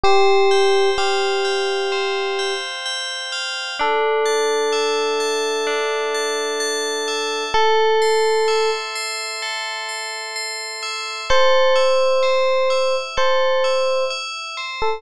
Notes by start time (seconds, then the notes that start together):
0.04 G4 C5
0.51 G5
0.98 G4 F5
1.45 G5
1.92 C5
2.39 G5
2.86 G5
3.32 F5
3.79 D4 A4
4.26 A5
4.72 E5
5.20 A5
5.67 D4
6.14 A5
6.60 A5
7.08 E5
7.54 A4
8.02 C6
8.48 E5
8.96 C6
9.42 A4
9.89 C6
10.36 C6
10.83 E5
11.30 A4 C5
11.76 E5
12.23 C5
12.70 E5
13.17 A4 C5
13.64 E5
14.11 E5
14.57 C5
14.82 A4